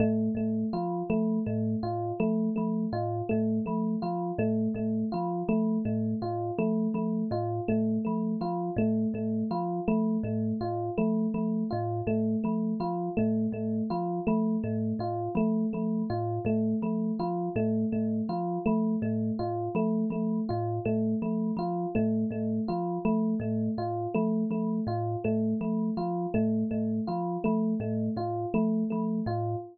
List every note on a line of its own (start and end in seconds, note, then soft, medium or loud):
0.00 0.29 A2 medium
0.00 0.29 A3 medium
0.35 0.64 A2 medium
0.35 0.66 A3 medium
0.73 1.03 F3 medium
0.73 1.02 F4 medium
1.10 1.39 F3 medium
1.10 1.39 A3 medium
1.46 1.76 A2 medium
1.46 1.76 A3 medium
1.83 2.12 A2 medium
1.83 2.12 F4 medium
2.20 2.49 F3 medium
2.20 2.49 A3 medium
2.56 2.87 F3 medium
2.56 2.85 A3 medium
2.93 3.22 A2 medium
2.93 3.22 F4 medium
3.29 3.60 A2 medium
3.29 3.58 A3 medium
3.66 3.96 F3 medium
3.66 3.95 A3 medium
4.02 4.32 F3 medium
4.02 4.31 F4 medium
4.38 4.68 A2 medium
4.38 4.68 A3 medium
4.75 5.04 A2 medium
4.75 5.05 A3 medium
5.12 5.43 F3 medium
5.12 5.41 F4 medium
5.49 5.78 F3 medium
5.49 5.78 A3 medium
5.85 6.14 A2 medium
5.85 6.14 A3 medium
6.22 6.51 A2 medium
6.22 6.51 F4 medium
6.59 6.88 F3 medium
6.59 6.88 A3 medium
6.94 7.23 F3 medium
6.94 7.24 A3 medium
7.31 7.60 A2 medium
7.31 7.61 F4 medium
7.68 7.99 A2 medium
7.68 7.98 A3 medium
8.05 8.36 F3 medium
8.05 8.34 A3 medium
8.41 8.70 F3 medium
8.41 8.71 F4 medium
8.77 9.06 A2 medium
8.77 9.07 A3 medium
9.14 9.43 A2 medium
9.14 9.44 A3 medium
9.51 9.80 F3 medium
9.51 9.80 F4 medium
9.88 10.18 F3 medium
9.88 10.17 A3 medium
10.23 10.53 A2 medium
10.23 10.54 A3 medium
10.61 10.90 A2 medium
10.61 10.90 F4 medium
10.98 11.27 F3 medium
10.98 11.27 A3 medium
11.34 11.64 F3 medium
11.34 11.63 A3 medium
11.71 12.02 A2 medium
11.71 12.00 F4 medium
12.07 12.36 A2 medium
12.07 12.37 A3 medium
12.44 12.74 F3 medium
12.44 12.73 A3 medium
12.80 13.09 F3 medium
12.80 13.10 F4 medium
13.17 13.48 A2 medium
13.17 13.46 A3 medium
13.52 13.82 A2 medium
13.52 13.83 A3 medium
13.90 14.20 F3 medium
13.90 14.20 F4 medium
14.27 14.57 F3 medium
14.27 14.56 A3 medium
14.64 14.93 A2 medium
14.64 14.93 A3 medium
14.99 15.29 A2 medium
14.99 15.30 F4 medium
15.35 15.64 F3 medium
15.35 15.66 A3 medium
15.73 16.04 F3 medium
15.73 16.02 A3 medium
16.10 16.39 A2 medium
16.10 16.39 F4 medium
16.45 16.74 A2 medium
16.45 16.75 A3 medium
16.82 17.12 F3 medium
16.82 17.12 A3 medium
17.20 17.49 F3 medium
17.20 17.49 F4 medium
17.56 17.85 A2 medium
17.56 17.85 A3 medium
17.92 18.22 A2 medium
17.92 18.22 A3 medium
18.29 18.58 F3 medium
18.29 18.59 F4 medium
18.66 18.96 F3 medium
18.66 18.95 A3 medium
19.02 19.31 A2 medium
19.02 19.32 A3 medium
19.39 19.69 A2 medium
19.39 19.68 F4 medium
19.75 20.04 F3 medium
19.75 20.05 A3 medium
20.10 20.40 F3 medium
20.10 20.41 A3 medium
20.49 20.80 A2 medium
20.49 20.78 F4 medium
20.85 21.15 A2 medium
20.85 21.15 A3 medium
21.22 21.51 F3 medium
21.22 21.51 A3 medium
21.57 21.86 F3 medium
21.57 21.88 F4 medium
21.95 22.25 A2 medium
21.95 22.24 A3 medium
22.31 22.60 A2 medium
22.31 22.61 A3 medium
22.68 22.98 F3 medium
22.68 22.98 F4 medium
23.05 23.34 F3 medium
23.05 23.34 A3 medium
23.40 23.69 A2 medium
23.40 23.70 A3 medium
23.78 24.07 A2 medium
23.78 24.07 F4 medium
24.14 24.45 F3 medium
24.14 24.44 A3 medium
24.51 24.80 F3 medium
24.51 24.81 A3 medium
24.87 25.16 A2 medium
24.87 25.17 F4 medium
25.24 25.54 A2 medium
25.24 25.54 A3 medium
25.61 25.90 F3 medium
25.61 25.90 A3 medium
25.97 26.27 F3 medium
25.97 26.27 F4 medium
26.34 26.64 A2 medium
26.34 26.63 A3 medium
26.71 27.00 A2 medium
26.71 27.00 A3 medium
27.07 27.38 F3 medium
27.07 27.37 F4 medium
27.44 27.75 F3 medium
27.44 27.73 A3 medium
27.80 28.09 A2 medium
27.80 28.10 A3 medium
28.16 28.46 A2 medium
28.16 28.46 F4 medium
28.54 28.84 F3 medium
28.54 28.83 A3 medium
28.90 29.21 F3 medium
28.90 29.20 A3 medium
29.26 29.56 A2 medium
29.26 29.56 F4 medium